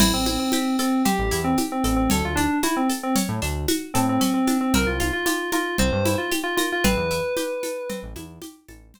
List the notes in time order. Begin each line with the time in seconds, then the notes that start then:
0.00 A1 C4 E4, crash, low conga, shaker
0.14 A1 C4
0.26 C4 E4, high conga, shaker
0.39 C4
0.52 C4 G4, high conga, shaker
0.79 C4 A4, shaker
1.05 C4 G4, low conga, shaker
1.19 A1
1.31 E2 E4, shaker
1.44 C4
1.57 G4, high conga, shaker
1.72 C4
1.84 A1 C4 A4, shaker
1.96 C4
2.10 D2 C#4 A4, low conga, shaker
2.24 D2 F4
2.36 D4, high conga, shaker
2.63 E4 F#4, high conga, shaker
2.77 C4
2.89 A4, shaker
3.03 C4
3.16 C#4, low conga, shaker
3.29 A2
3.42 D2 D4, shaker
3.68 F#4, high conga, shaker
3.94 A2 C4 A4, shaker
4.09 C4
4.20 C4 C#4, low conga, shaker
4.34 C4
4.47 D4, high conga, shaker
4.61 C4
4.74 C2 C4 A#4, low conga, shaker
4.87 C2 F4
5.00 F4, high conga, shaker
5.13 F4
5.26 F4 G4, high conga, shaker
5.52 F4 A#4, high conga, shaker
5.78 C2 C4 C5, low conga
5.92 G2
6.05 E4, high conga, shaker
6.18 F4
6.31 G4, high conga, shaker
6.44 F4
6.57 F4 A#4, high conga, shaker
6.72 F4
6.84 A1 C4 B4, low conga, shaker
6.97 E2
7.11 E4, shaker
7.37 G4, high conga, shaker
7.63 A4, high conga, shaker
7.89 C4, low conga, shaker
8.03 A1
8.16 E2 E4, high conga, shaker
8.42 G4, high conga, shaker
8.68 A1 A4, high conga, shaker
8.94 C4, low conga, shaker